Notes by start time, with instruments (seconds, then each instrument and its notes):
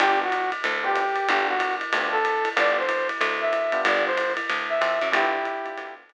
0.00 electric bass (finger) G1, electric piano 1 B3 D4 F4 G4, brass section G4, ride
0.23 brass section F#4
0.32 hi-hat pedal, ride
0.52 ride
0.64 electric bass (finger) D2, ride
0.84 electric piano 1 B3 D4 F4 G4, brass section G4
0.96 kick, hi-hat pedal, ride
1.16 ride
1.29 electric bass (finger) G1, electric piano 1 B3 D4 F4 G4, brass section G4, ride
1.48 brass section F#4
1.60 kick, hi-hat pedal, ride
1.81 ride
1.93 electric bass (finger) D2, electric piano 1 B3 D4 F4 G4, ride
2.12 brass section A4
2.25 hi-hat pedal, ride
2.45 ride
2.56 electric bass (finger) G1, electric piano 1 B3 D4 F4 G4, brass section D5, ride
2.78 brass section C5
2.89 hi-hat pedal, ride
3.09 ride
3.21 electric bass (finger) D2, ride
3.41 brass section E5
3.53 hi-hat pedal, ride
3.72 electric piano 1 B3 D4 F4 G4, ride
3.85 electric bass (finger) G1, brass section D5, ride
4.06 brass section C5
4.18 hi-hat pedal, ride
4.37 ride
4.49 electric bass (finger) D2, ride
4.69 brass section E5
4.81 electric bass (finger) F2, kick, hi-hat pedal, ride
5.02 electric bass (finger) F#2, ride
5.12 electric bass (finger) G1, electric piano 1 B3 D4 F4 G4, brass section E4 G4, ride
5.45 kick, hi-hat pedal, ride
5.65 electric piano 1 B3 D4 F4 G4, ride
5.77 electric bass (finger) D2, electric piano 1 B3 D4 F4 G4, kick, ride
6.09 hi-hat pedal, ride